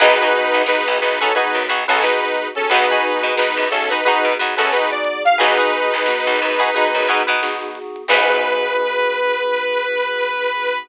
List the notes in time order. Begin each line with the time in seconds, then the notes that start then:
0.00 B1 B3 D#4 F#4 G#4 B4, kick, crash
0.19 F#4 G#4 B4, snare, closed hi-hat
0.23 D#4
0.33 closed hi-hat
0.53 B1, closed hi-hat
0.66 B3 D#4 F#4 G#4 B4, snare
0.86 B1, closed hi-hat
1.01 B1 D#4 B4, closed hi-hat
1.19 C#4 D#4 F#4 G#4 A4 B4, kick, closed hi-hat
1.34 B3 D#4 F#4 G#4 B4, kick, closed hi-hat
1.54 F#2, closed hi-hat
1.68 B1 D#4 F#4 G#4 B4, snare, closed hi-hat
1.88 B1 C#4 D#4 F#4 G#4 A4 B4, closed hi-hat
2.02 B3 D#4 F#4 G#4 B4, snare
2.21 D#4 B4, closed hi-hat
2.35 kick, closed hi-hat
2.55 C#4 A4, closed hi-hat
2.70 B1 B3 D#4 F#4 G#4 B4, kick, closed hi-hat
2.89 D#4 F#4 G#4 B4, snare, closed hi-hat
3.04 closed hi-hat
3.22 B2, closed hi-hat
3.36 B3 D#4 F#4 G#4 B4, snare
3.56 F#2, closed hi-hat
3.71 B1 C#4 A4, closed hi-hat
3.89 D#4 F#4 G#4 B4, closed hi-hat
4.04 B3 D#4 F#4 G#4 B4, kick, closed hi-hat
4.24 B2, closed hi-hat
4.39 F#2 D#4 F#4 G#4 B4, closed hi-hat
4.57 F#2 C#4 D#4 F#4 G#4 A4 B4, closed hi-hat
4.72 B3 D#4 F#4 G#4 B4, snare
4.90 D5, closed hi-hat
5.04 kick, closed hi-hat
5.25 F5, snare, closed hi-hat
5.38 B1 B3 D#4 F#4 G#4 B4, kick, closed hi-hat
5.57 D#4 F#4 G#4 B4, snare, closed hi-hat
5.74 closed hi-hat
5.92 B1, closed hi-hat
6.06 B3 D#4 F#4 G#4, snare
6.26 B1, closed hi-hat
6.39 F#2, closed hi-hat
6.59 D#4 F#4 G#4 B4, kick, closed hi-hat
6.74 B3 D#4 F#4 G#4 B4, kick, closed hi-hat
6.93 F#2, closed hi-hat
7.08 B2 D#4 F#4 G#4 B4, closed hi-hat
7.27 B2 D#4 F#4 G#4 B4, closed hi-hat
7.42 B3 D#4 F#4 G#4, snare
7.61 closed hi-hat
7.75 closed hi-hat
7.96 closed hi-hat
8.08 B1 B3 D#4 F#4 G#4 B4, kick, crash